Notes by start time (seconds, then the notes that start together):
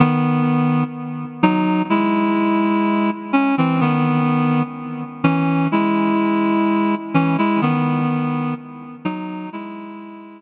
0.00 D#3 B3
1.43 F#3 D#4
1.90 G#3 E4
3.33 C#4
3.58 E3 C4
3.81 D#3 B3
5.24 E3 C#4
5.72 G#3 E4
7.14 E3 C#4
7.38 G#3 E4
7.62 D#3 B3
9.05 F#3 D#4
9.53 G#3 E4